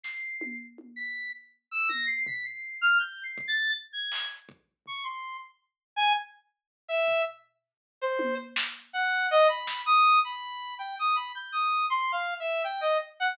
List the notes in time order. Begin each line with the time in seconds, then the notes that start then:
0.04 C7, snare
0.40 C7, high tom
0.78 high tom
0.96 B6
1.71 E6
1.89 A#6, high tom
2.06 C7
2.27 B6, floor tom
2.44 C7
2.81 F6
2.99 G6
3.23 C7
3.38 kick
3.48 A6
3.93 G#6
4.12 clap
4.49 kick
4.86 C#6, floor tom
5.04 C6
5.96 G#5
6.88 E5
7.08 floor tom
8.02 C5
8.19 high tom
8.56 snare
8.93 F#5
9.31 D#5
9.48 B5
9.67 snare
9.86 D#6
10.24 B5
10.79 G5
10.99 D#6
11.16 B5
11.35 G6
11.52 D#6
11.90 C6
12.12 F5
12.40 E5
12.64 G5
12.81 D#5
13.20 F#5